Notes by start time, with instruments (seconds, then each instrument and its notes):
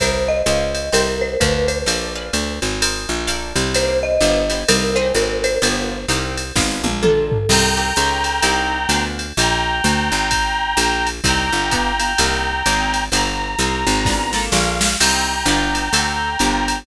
0.00 electric bass (finger) C2, acoustic guitar (steel) A#4 C5 D#5 G5, marimba C5, kick, ride
0.28 marimba D#5
0.46 electric bass (finger) C#2, acoustic guitar (steel) C#5 D#5 F5 G#5, hi-hat pedal, ride
0.75 ride
0.92 electric bass (finger) C2, marimba A#4, acoustic guitar (steel) C5 D#5 G5 A#5, ride
1.21 marimba C5
1.40 electric bass (finger) D2, marimba B4, acoustic guitar (steel) B4 D5 F5 G#5, kick, hi-hat pedal, ride
1.68 marimba C5, ride
1.86 electric bass (finger) A#1, acoustic guitar (steel) A#4 D5 F5 A5, ride
2.16 acoustic guitar (steel) B4 D5 F5 G#5
2.33 electric bass (finger) D2, hi-hat pedal, ride
2.62 electric bass (finger) G#1, ride
2.82 acoustic guitar (steel) A#4 C5 D#5 G#5, ride
3.09 electric bass (finger) A#1
3.27 acoustic guitar (steel) A4 A#4 D5 F5, hi-hat pedal, ride
3.56 electric bass (finger) C2, ride
3.74 acoustic guitar (steel) A#3 C4 D#4 G4, marimba C5, ride
4.03 marimba D#5
4.21 electric bass (finger) G1, acoustic guitar (steel) B3 E4 F4 G4, hi-hat pedal, ride
4.50 acoustic guitar (steel) B3 E4 F4 G4, ride
4.68 electric bass (finger) C2, acoustic guitar (steel) A#3 C4 D#4 G4, marimba A#4, ride
4.96 acoustic guitar (steel) A#3 C4 D#4 G#4, marimba C5
5.14 electric bass (finger) G#1, marimba A#4, hi-hat pedal, ride
5.44 marimba C5, ride
5.62 electric bass (finger) G1, acoustic guitar (steel) B3 E4 F4 G4, ride
6.08 electric bass (finger) C2, acoustic guitar (steel) A#3 C4 D#4 G4, hi-hat pedal, ride
6.37 ride
6.56 electric bass (finger) G#1, acoustic guitar (steel) B3 D4 F4 G#4, kick, snare
6.84 electric bass (finger) A#1, high tom
7.03 acoustic guitar (steel) A#3 D4 F4 A4, marimba A4, mid tom
7.32 floor tom
7.49 electric bass (finger) C2, acoustic guitar (steel) A#3 C4 D#4 G4, clarinet G5 A#5, crash, ride
7.77 acoustic guitar (steel) A#3 C4 D#4 G4
7.96 electric bass (finger) C#2, acoustic guitar (steel) C#4 D#4 F4 G#4, hi-hat pedal, ride
8.24 ride
8.42 electric bass (finger) C2, acoustic guitar (steel) C4 D#4 G4 A#4, ride
8.89 electric bass (finger) D2, acoustic guitar (steel) B3 D4 F4 G#4, hi-hat pedal, ride
9.19 ride
9.37 electric bass (finger) A#1, clarinet G5 A#5, ride
9.84 electric bass (finger) D2, hi-hat pedal, ride
10.12 electric bass (finger) G#1, ride
10.31 kick, ride
10.77 electric bass (finger) A#1, hi-hat pedal, ride
11.07 ride
11.24 electric bass (finger) C2, acoustic guitar (steel) A#3 C4 D#4 G4, clarinet G5 A#5, kick, ride
11.52 electric bass (finger) G1
11.71 acoustic guitar (steel) B3 E4 F4 G4, kick, hi-hat pedal, ride
12.00 acoustic guitar (steel) B3 E4 F4 G4, ride
12.18 electric bass (finger) C2, acoustic guitar (steel) A#3 C4 D#4 G4, ride
12.66 electric bass (finger) G#1, acoustic guitar (steel) A#3 C4 D#4 G#4, hi-hat pedal, ride
12.94 ride
13.12 electric bass (finger) G1, acoustic guitar (steel) B3 E4 F4 G4, clarinet A#5, ride
13.59 electric bass (finger) C2, acoustic guitar (steel) A#3 C4 D#4 G4, hi-hat pedal, ride
13.87 electric bass (finger) G#1, ride
14.05 acoustic guitar (steel) B3 D4 F4 G#4, kick, snare
14.33 acoustic guitar (steel) A#3 D4 F4 A4, snare
14.52 electric bass (finger) A#1, clarinet F5, snare
14.81 snare
15.00 electric bass (finger) C2, acoustic guitar (steel) A#3 C4 D#4 G4, clarinet G5 A#5, crash, ride
15.46 electric bass (finger) G1, acoustic guitar (steel) B3 E4 F4 G4, hi-hat pedal, ride
15.75 ride
15.93 electric bass (finger) D2, acoustic guitar (steel) A3 C4 D4 F#4, ride
16.39 electric bass (finger) G1, acoustic guitar (steel) A#3 D4 F4 G4, hi-hat pedal, ride
16.68 ride